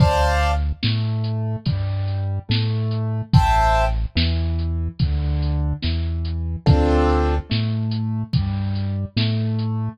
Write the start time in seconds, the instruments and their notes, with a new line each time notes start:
0.00 synth bass 1 D2, acoustic grand piano C5 D5 F5 A5, kick, crash
0.42 closed hi-hat
0.83 synth bass 1 A2, acoustic grand piano A3, snare
1.24 closed hi-hat
1.65 synth bass 1 G2, acoustic grand piano G3, kick, closed hi-hat
2.07 closed hi-hat
2.49 synth bass 1 A2, acoustic grand piano A3, snare
2.91 closed hi-hat
3.33 synth bass 1 A1, acoustic grand piano C5 E5 G5 A5, kick, closed hi-hat
3.75 closed hi-hat
4.15 synth bass 1 E2, acoustic grand piano E3, snare
4.59 closed hi-hat
4.99 synth bass 1 D2, acoustic grand piano D3, kick, closed hi-hat
5.42 closed hi-hat
5.82 synth bass 1 E2, acoustic grand piano E3, snare
6.25 closed hi-hat
6.66 synth bass 1 D2, acoustic grand piano C4 D4 F4 A4, kick, closed hi-hat
7.09 closed hi-hat
7.50 synth bass 1 A2, acoustic grand piano A3, snare
7.91 closed hi-hat
8.33 synth bass 1 G2, acoustic grand piano G3, kick, closed hi-hat
8.75 closed hi-hat
9.16 synth bass 1 A2, acoustic grand piano A3, snare
9.59 closed hi-hat